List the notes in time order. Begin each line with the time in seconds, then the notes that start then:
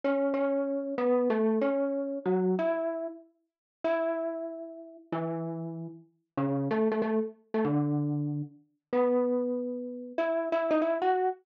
0.04 C#4 C#5
0.34 C#4 C#5
0.98 B3 B4
1.30 A3 A4
1.61 C#4 C#5
2.26 F#3 F#4
2.59 E4 E5
3.84 E4 E5
5.12 E3 E4
6.37 C#3 C#4
6.71 A3 A4
6.92 A3 A4
7.02 A3 A4
7.54 A3 A4
7.65 D3 D4
8.93 B3 B4
10.18 E4 E5
10.52 E4 E5
10.71 D#4 D#5
10.82 E4 E5
11.02 F#4 F#5